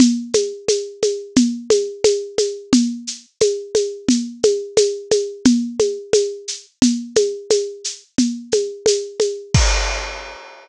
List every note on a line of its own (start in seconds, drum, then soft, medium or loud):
0.00 low conga loud
0.00 shaker medium
0.34 high conga medium
0.34 shaker medium
0.68 high conga medium
0.68 shaker medium
1.02 high conga medium
1.02 shaker medium
1.36 low conga medium
1.36 shaker medium
1.70 high conga medium
1.70 shaker medium
2.04 high conga medium
2.04 shaker medium
2.38 high conga medium
2.38 shaker medium
2.73 low conga medium
2.73 shaker medium
3.07 shaker medium
3.40 high conga medium
3.40 shaker medium
3.75 high conga medium
3.75 shaker medium
4.09 low conga medium
4.09 shaker medium
4.43 high conga medium
4.43 shaker medium
4.77 high conga medium
4.77 shaker medium
5.11 high conga medium
5.11 shaker medium
5.45 low conga loud
5.45 shaker medium
5.79 high conga medium
5.79 shaker medium
6.13 high conga medium
6.13 shaker medium
6.48 shaker medium
6.82 low conga medium
6.82 shaker medium
7.16 high conga medium
7.16 shaker medium
7.50 high conga medium
7.50 shaker medium
7.84 shaker medium
8.18 low conga medium
8.18 shaker medium
8.52 high conga medium
8.52 shaker medium
8.86 high conga medium
8.86 shaker medium
9.20 high conga medium
9.20 shaker medium
9.54 kick loud
9.54 crash loud